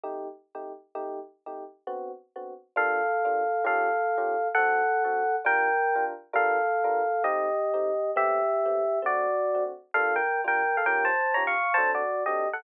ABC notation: X:1
M:3/4
L:1/8
Q:"Swing" 1/4=200
K:Gm
V:1 name="Electric Piano 1"
z6 | z6 | z6 | [Af]6 |
[Af]6 | [A^f]6 | [Bg]4 z2 | [Af]6 |
[Ge]6 | [G=e]6 | [^Fd]4 z2 | [Af] [Bg]2 [Bg]2 [Af] |
[Bg] [ca]2 [_db] [f_d']2 | [ca] [^Fd]2 [Ge]2 [A^f] |]
V:2 name="Electric Piano 1"
[C,A,EG]3 [C,A,EG]3 | [C,A,EG]3 [C,A,EG]3 | [D,=B,C^F]3 [D,B,CF]3 | [G,B,DF]3 [G,B,DF]3 |
[E,_DFG]3 [E,DFG]3 | [D,C^F]3 [D,CFA]3 | [G,DF]3 [G,DFB]3 | [G,DFB]3 [G,DFB]3 |
[A,CE]3 [A,CEG]3 | [A,=B,C]3 [A,B,CG]3 | [D,A,C]3 [D,A,C^F]3 | [G,B,DF]3 [G,B,DF]3 |
[E,_DFG]3 [E,DFG]3 | [^F,CDA]3 [F,CDA]3 |]